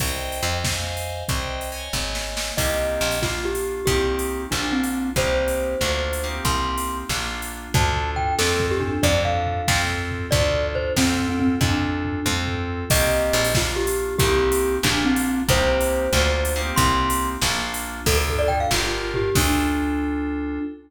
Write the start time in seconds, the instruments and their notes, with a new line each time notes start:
0.00 electric bass (finger) C2, electric piano 2 C5 D#5 G5, kick, crash
0.32 open hi-hat
0.43 electric bass (finger) F2
0.64 electric piano 2 C5 D#5 F5 G#5, kick, snare
0.97 open hi-hat
1.28 electric bass (finger) C2, electric piano 2 C5 D#5 G5, kick, closed hi-hat
1.61 open hi-hat
1.72 electric piano 2 C#5 D#5 G#5
1.93 electric bass (finger) G#1, kick, snare
2.15 snare
2.37 snare
2.57 electric bass (finger) C2, electric piano 2 A#3 C4 D#4 G4, glockenspiel D#5, kick, crash
3.01 electric bass (finger) A#1
3.11 open hi-hat
3.22 electric piano 2 A#3 D4 F4, glockenspiel F4, kick, snare
3.45 glockenspiel G4
3.55 open hi-hat
3.86 electric bass (finger) C2, electric piano 2 A#3 C4 D#4 G4, glockenspiel G4, kick, closed hi-hat
4.19 open hi-hat
4.51 electric bass (finger) A#1, electric piano 2 A#3 D4 F4, glockenspiel D4, kick, clap
4.72 glockenspiel C4
4.84 open hi-hat
5.16 electric bass (finger) C2, electric piano 2 A#3 C4 D#4 G4, glockenspiel C5, kick, closed hi-hat
5.48 open hi-hat
5.81 electric bass (finger) D2, electric piano 2 A#3 D4 F4, kick, clap
6.13 open hi-hat
6.24 electric piano 2 A#3 C4 D#4 G4
6.45 electric bass (finger) C2, glockenspiel C6, kick, closed hi-hat
6.78 open hi-hat
7.09 electric bass (finger) A#1, electric piano 2 A#3 D4 F4, kick, snare
7.42 open hi-hat
7.74 electric bass (finger) D2, electric piano 2 D4 F4 A4, glockenspiel A5, kick, floor tom
7.96 floor tom
8.16 glockenspiel G5, floor tom
8.39 electric bass (finger) F2, electric piano 2 C4 F4 A4, glockenspiel A4, snare
8.60 kick, floor tom
8.71 glockenspiel G4
8.80 glockenspiel D4, floor tom
9.03 electric bass (finger) F2, electric piano 2 D4 F4 A4, glockenspiel D5, kick, floor tom
9.25 glockenspiel F5, floor tom
9.46 floor tom
9.68 electric bass (finger) F2, electric piano 2 C4 F4 A4, kick, snare
9.89 floor tom
10.11 floor tom
10.31 electric bass (finger) D2, electric piano 2 D4 F4 A4, glockenspiel D5, kick, floor tom
10.54 floor tom
10.75 glockenspiel C5, floor tom
10.97 electric bass (finger) F2, electric piano 2 C4 F4 A4, glockenspiel C4, kick, snare
11.19 floor tom
11.29 glockenspiel C4
11.40 glockenspiel C4, floor tom
11.61 electric bass (finger) F2, glockenspiel D4, electric piano 2 D4 F4 A4, kick, floor tom
11.83 floor tom
12.05 floor tom
12.26 electric bass (finger) F2, electric piano 2 C4 F4 A4, kick, high tom
12.47 floor tom
12.90 electric bass (finger) C2, electric piano 2 A#3 C4 D#4 G4, glockenspiel D#5, kick, crash
13.33 electric bass (finger) A#1
13.44 open hi-hat
13.54 electric piano 2 A#3 D4 F4, glockenspiel F4, kick, snare
13.76 glockenspiel G4
13.87 open hi-hat
14.18 electric bass (finger) C2, electric piano 2 A#3 C4 D#4 G4, glockenspiel G4, kick, closed hi-hat
14.52 open hi-hat
14.83 electric bass (finger) A#1, electric piano 2 A#3 D4 F4, glockenspiel D4, kick, clap
15.05 glockenspiel C4
15.16 open hi-hat
15.48 electric bass (finger) C2, electric piano 2 A#3 C4 D#4 G4, glockenspiel C5, kick, closed hi-hat
15.81 open hi-hat
16.13 electric bass (finger) D2, electric piano 2 A#3 D4 F4, kick, clap
16.45 open hi-hat
16.56 electric piano 2 A#3 C4 D#4 G4
16.76 electric bass (finger) C2, glockenspiel C6, kick, closed hi-hat
17.10 open hi-hat
17.41 electric bass (finger) A#1, electric piano 2 A#3 D4 F4, kick, snare
17.74 open hi-hat
18.06 electric bass (finger) D2, electric piano 2 D4 F4 A4, glockenspiel A4, kick, crash
18.18 glockenspiel A4
18.28 glockenspiel A4, floor tom
18.39 glockenspiel D5
18.48 glockenspiel G5, floor tom
18.60 glockenspiel F5
18.71 electric bass (finger) G1, electric piano 2 D4 F4 G4 A#4, glockenspiel F4, kick, snare
19.14 glockenspiel G4, floor tom
19.35 electric bass (finger) D2, electric piano 2 D4 F4 A4, glockenspiel D4, kick, crash